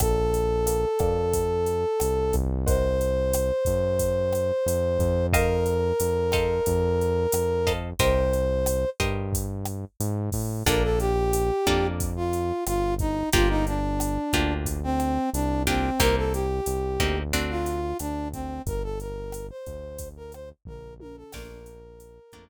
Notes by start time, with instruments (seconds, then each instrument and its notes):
0.00 synth bass 1 A#1, brass section A4, acoustic guitar (steel) A#4 D5 F5 A5, kick, cross-stick, closed hi-hat
0.34 closed hi-hat
0.66 acoustic guitar (steel) A#4 D5 F5 A5, closed hi-hat
0.99 synth bass 1 F2, acoustic guitar (steel) A#4 D5 F5 A5, kick, cross-stick, closed hi-hat
1.33 kick, closed hi-hat
1.66 closed hi-hat
2.00 synth bass 1 C2, cross-stick, closed hi-hat
2.33 synth bass 1 C2, kick, closed hi-hat
2.67 acoustic guitar (steel) A#4 C5 D#5 F#5, brass section C5, kick, closed hi-hat
3.01 closed hi-hat
3.33 cross-stick, closed hi-hat
3.65 synth bass 1 F#2, kick, closed hi-hat
3.99 kick, closed hi-hat
4.33 cross-stick, closed hi-hat
4.66 synth bass 1 F2, closed hi-hat
4.99 synth bass 1 F2, kick, closed hi-hat
5.33 brass section A#4, acoustic guitar (steel) A#4 C5 D#5 F5, kick, cross-stick, closed hi-hat
5.66 closed hi-hat
6.00 synth bass 1 F2, closed hi-hat
6.32 acoustic guitar (steel) A4 C5 D#5 F5, kick, cross-stick, closed hi-hat
6.66 synth bass 1 F2, kick, closed hi-hat
7.01 closed hi-hat
7.32 synth bass 1 F2, cross-stick, closed hi-hat
7.67 acoustic guitar (steel) A4 C5 D#5 F5, kick, closed hi-hat
7.99 synth bass 1 C2, acoustic guitar (steel) G4 A#4 C5 D#5, brass section C5, kick, closed hi-hat
8.33 closed hi-hat
8.66 cross-stick, closed hi-hat
9.00 synth bass 1 G2, acoustic guitar (steel) G4 A#4 C5 D#5, kick, closed hi-hat
9.33 kick, closed hi-hat
9.65 cross-stick, closed hi-hat
10.00 synth bass 1 G#2, closed hi-hat
10.32 synth bass 1 A2, kick, open hi-hat
10.66 synth bass 1 A#1, acoustic guitar (steel) A#3 D4 F4 A4, brass section A#4, kick, cross-stick, closed hi-hat
10.83 brass section A4
11.00 brass section G4, closed hi-hat
11.33 closed hi-hat
11.67 synth bass 1 F2, acoustic guitar (steel) A#3 D4 F4 A4, kick, cross-stick, closed hi-hat
12.00 kick, closed hi-hat
12.16 brass section F4
12.33 closed hi-hat
12.67 synth bass 1 G1, brass section F4, cross-stick, closed hi-hat
12.99 brass section D#4, kick, closed hi-hat
13.33 synth bass 1 G1, acoustic guitar (steel) A#3 D4 F4 G4, brass section F4, kick, closed hi-hat
13.49 brass section D#4
13.67 brass section D4, closed hi-hat
14.00 cross-stick, closed hi-hat
14.33 synth bass 1 D2, acoustic guitar (steel) A#3 D4 F4 G4, kick, closed hi-hat
14.66 kick, closed hi-hat
14.83 brass section C4
15.00 cross-stick, closed hi-hat
15.33 synth bass 1 C2, brass section D4, closed hi-hat
15.67 acoustic guitar (steel) A#3 D4 F4 G4, brass section C4, kick, closed hi-hat
16.00 synth bass 1 C2, acoustic guitar (steel) A#3 C4 D#4 G4, brass section A#4, kick, cross-stick, closed hi-hat
16.17 brass section A4
16.33 brass section G4, closed hi-hat
16.66 synth bass 1 C2, closed hi-hat
17.00 synth bass 1 D2, acoustic guitar (steel) A#3 C4 D#4 G4, kick, cross-stick, closed hi-hat
17.33 acoustic guitar (steel) A3 C4 D4 F#4, kick, closed hi-hat
17.50 brass section F4
17.66 closed hi-hat
17.99 synth bass 1 D2, brass section D4, cross-stick, closed hi-hat
18.33 brass section C4, kick, closed hi-hat
18.66 synth bass 1 G1, brass section A#4, kick, closed hi-hat
18.83 brass section A4
19.00 brass section A#4, closed hi-hat
19.32 cross-stick, closed hi-hat
19.50 brass section C5
19.66 synth bass 1 D2, kick, closed hi-hat
19.98 kick, closed hi-hat
20.17 brass section A#4
20.32 brass section C5, cross-stick, closed hi-hat
20.65 synth bass 1 A#1, brass section A#4, kick, floor tom
21.00 brass section A#4, high tom
21.17 brass section A4
21.33 synth bass 1 A#1, acoustic guitar (steel) A3 A#3 D4 F4, brass section A#4, kick, cross-stick, crash
21.66 closed hi-hat
22.00 closed hi-hat
22.32 synth bass 1 F2, acoustic guitar (steel) A3 A#3 D4 F4, kick, cross-stick, closed hi-hat